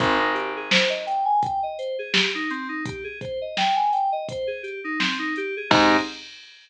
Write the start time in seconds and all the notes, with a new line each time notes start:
0.00 G#1 C4, kick, closed hi-hat
0.19 D#4
0.34 G4, closed hi-hat
0.57 G#4
0.71 C5, snare
0.90 D#5
1.07 G5, closed hi-hat
1.25 G#5
1.43 G5, kick, closed hi-hat
1.63 D#5
1.78 C5, closed hi-hat
1.99 G#4
2.13 G4, snare
2.35 D#4
2.50 C4, closed hi-hat
2.69 D#4
2.85 G4, kick, closed hi-hat
3.04 G#4
3.21 C5, kick, closed hi-hat
3.41 D#5
3.57 G5, snare
3.76 G#5
3.93 G5, closed hi-hat
4.12 D#5
4.29 C5, kick, closed hi-hat
4.47 G#4
4.63 G4, closed hi-hat
4.84 D#4
4.99 C4, snare
5.19 D#4
5.36 G4, closed hi-hat
5.57 G#4
5.70 G#2 C4 D#4 G4 G#4, kick, crash